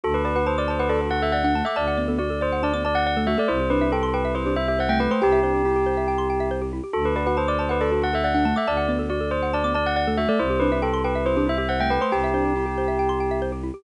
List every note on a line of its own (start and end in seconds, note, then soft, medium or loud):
0.04 1.62 D2 medium
0.04 0.13 F#4 medium
0.04 0.14 A4 medium
0.14 0.25 A4 medium
0.14 0.24 B4 medium
0.25 0.36 F#4 medium
0.25 0.35 B4 medium
0.25 0.35 D5 medium
0.35 0.46 F#4 medium
0.35 0.46 B4 medium
0.35 0.46 F#5 medium
0.46 0.57 C5 medium
0.46 0.56 A5 medium
0.58 0.69 D5 medium
0.58 0.68 D6 medium
0.68 0.80 C5 medium
0.68 0.78 A5 medium
0.79 0.90 B4 medium
0.79 0.89 F#5 medium
0.89 1.08 A4 medium
0.89 1.00 A4 medium
0.89 0.99 D5 medium
1.01 1.11 F#4 medium
1.01 1.11 A4 medium
1.11 1.22 F#4 medium
1.11 1.21 F#5 medium
1.22 1.32 A4 medium
1.22 1.33 E5 medium
1.32 1.43 D5 medium
1.32 1.62 F#5 medium
1.44 1.54 D4 medium
1.44 1.54 F#5 medium
1.55 1.65 A3 medium
1.55 1.65 A5 medium
1.65 1.76 A3 loud
1.65 1.75 E5 medium
1.65 1.76 D6 medium
1.76 3.35 D2 medium
1.76 1.97 D5 medium
1.76 1.86 A5 medium
1.88 1.97 F#5 medium
1.97 2.08 B3 medium
1.97 2.07 D5 medium
2.08 2.19 B3 medium
2.08 2.18 A4 medium
2.19 2.29 F#4 medium
2.19 2.40 D5 medium
2.30 2.40 A4 medium
2.41 2.61 C5 medium
2.41 2.51 D5 medium
2.52 2.62 F#5 medium
2.63 2.73 D4 medium
2.63 2.81 D5 medium
2.63 2.73 A5 medium
2.73 2.84 B3 medium
2.73 2.83 D6 medium
2.85 2.96 D5 medium
2.85 2.94 A5 medium
2.95 3.05 F#5 medium
3.06 3.16 D5 medium
3.06 3.17 F#5 medium
3.17 3.27 A3 medium
3.17 3.27 A4 medium
3.27 3.38 A3 loud
3.27 3.37 F#4 medium
3.27 3.37 E5 medium
3.38 3.49 A3 loud
3.38 3.48 A4 medium
3.38 3.49 D5 medium
3.48 5.08 C2 medium
3.48 3.59 E4 medium
3.48 3.67 C5 medium
3.60 3.70 G4 medium
3.70 3.81 D4 medium
3.70 3.88 B4 medium
3.70 3.81 C5 medium
3.81 3.92 D4 medium
3.81 3.91 E5 medium
3.92 4.10 A4 medium
3.92 4.02 G5 medium
4.03 4.13 C6 medium
4.14 4.33 B4 medium
4.14 4.23 G5 medium
4.25 4.35 E5 medium
4.35 4.46 E4 medium
4.35 4.53 C5 medium
4.35 4.45 C5 medium
4.46 4.56 D4 medium
4.46 4.55 G4 medium
4.56 4.67 E4 medium
4.56 4.67 E5 medium
4.68 4.78 G4 medium
4.68 4.79 E5 medium
4.79 4.88 C5 medium
4.79 4.90 F#5 medium
4.89 4.99 A3 medium
4.89 4.99 E5 medium
4.89 4.99 G5 medium
5.00 5.10 A3 medium
5.00 5.10 B4 medium
5.00 5.10 G5 medium
5.11 5.21 A3 medium
5.11 5.21 C5 medium
5.11 5.21 C6 medium
5.22 6.81 C2 medium
5.22 5.40 G4 loud
5.22 6.49 G4 medium
5.22 5.31 G5 medium
5.32 5.42 E5 medium
5.43 5.62 D4 medium
5.43 5.53 C5 medium
5.54 5.64 G4 medium
5.65 5.75 E4 medium
5.65 6.20 G4 medium
5.76 5.86 G4 medium
5.86 5.96 C5 medium
5.97 6.07 E5 medium
6.08 6.18 G5 medium
6.18 6.28 C6 medium
6.30 6.40 G5 medium
6.40 6.50 E5 medium
6.51 6.61 C5 medium
6.62 6.71 G4 medium
6.73 6.83 E4 medium
6.84 6.93 G4 medium
6.93 8.53 D2 medium
6.93 7.03 F#4 medium
6.93 7.04 A4 medium
7.05 7.15 A4 medium
7.05 7.15 B4 medium
7.16 7.26 F#4 medium
7.16 7.26 B4 medium
7.16 7.26 D5 medium
7.26 7.37 F#4 medium
7.26 7.37 B4 medium
7.26 7.37 F#5 medium
7.37 7.48 C5 medium
7.37 7.47 A5 medium
7.48 7.59 D5 medium
7.48 7.58 D6 medium
7.59 7.70 C5 medium
7.59 7.69 A5 medium
7.69 7.81 B4 medium
7.69 7.79 F#5 medium
7.81 7.91 A4 medium
7.81 8.00 A4 medium
7.81 7.90 D5 medium
7.91 8.02 F#4 medium
7.91 8.01 A4 medium
8.02 8.12 F#4 medium
8.02 8.14 F#5 medium
8.13 8.23 A4 medium
8.13 8.25 E5 medium
8.24 8.34 D5 medium
8.24 8.54 F#5 medium
8.35 8.45 D4 medium
8.35 8.44 F#5 medium
8.45 8.56 A3 medium
8.45 8.55 A5 medium
8.56 8.66 A3 loud
8.56 8.68 E5 medium
8.56 8.66 D6 medium
8.67 10.26 D2 medium
8.67 8.88 D5 medium
8.67 8.77 A5 medium
8.77 8.87 F#5 medium
8.88 8.99 B3 medium
8.88 8.99 D5 medium
8.99 9.10 B3 medium
8.99 9.09 A4 medium
9.10 9.20 F#4 medium
9.10 9.30 D5 medium
9.21 9.30 A4 medium
9.31 9.50 C5 medium
9.31 9.42 D5 medium
9.43 9.52 F#5 medium
9.53 9.63 D4 medium
9.53 9.72 D5 medium
9.53 9.63 A5 medium
9.64 9.74 B3 medium
9.64 9.74 D6 medium
9.74 9.86 D5 medium
9.74 9.84 A5 medium
9.86 9.96 F#5 medium
9.96 10.06 D5 medium
9.96 10.06 F#5 medium
10.07 10.18 A3 medium
10.07 10.17 A4 medium
10.17 10.28 A3 loud
10.17 10.28 F#4 medium
10.17 10.28 E5 medium
10.29 10.39 A3 loud
10.29 10.38 A4 medium
10.29 10.39 D5 medium
10.39 11.98 C2 medium
10.39 10.49 E4 medium
10.39 10.59 C5 medium
10.50 10.60 G4 medium
10.60 10.71 D4 medium
10.60 10.78 B4 medium
10.60 10.71 C5 medium
10.72 10.82 D4 medium
10.72 10.82 E5 medium
10.82 11.01 A4 medium
10.82 10.92 G5 medium
10.94 11.03 C6 medium
11.04 11.24 B4 medium
11.04 11.14 G5 medium
11.15 11.25 E5 medium
11.26 11.36 E4 medium
11.26 11.44 C5 medium
11.26 11.36 C5 medium
11.37 11.47 D4 medium
11.37 11.46 G4 medium
11.47 11.57 E4 medium
11.47 11.58 E5 medium
11.58 11.68 G4 medium
11.58 11.68 E5 medium
11.69 11.79 C5 medium
11.69 11.79 F#5 medium
11.80 11.90 A3 medium
11.80 11.89 E5 medium
11.80 11.91 G5 medium
11.90 12.01 A3 medium
11.90 12.01 B4 medium
11.90 12.01 G5 medium
12.01 12.12 A3 medium
12.01 12.11 C5 medium
12.01 12.12 C6 medium
12.12 13.71 C2 medium
12.12 13.38 G4 medium
12.12 12.30 G4 loud
12.12 12.22 G5 medium
12.24 12.34 E5 medium
12.34 12.53 D4 medium
12.34 12.44 C5 medium
12.45 12.55 G4 medium
12.56 12.65 E4 medium
12.56 13.11 G4 medium
12.66 12.76 G4 medium
12.78 12.88 C5 medium
12.88 12.98 E5 medium
12.99 13.09 G5 medium
13.09 13.19 C6 medium
13.20 13.30 G5 medium
13.31 13.41 E5 medium
13.42 13.52 C5 medium
13.52 13.62 G4 medium
13.63 13.73 E4 medium
13.74 13.83 G4 medium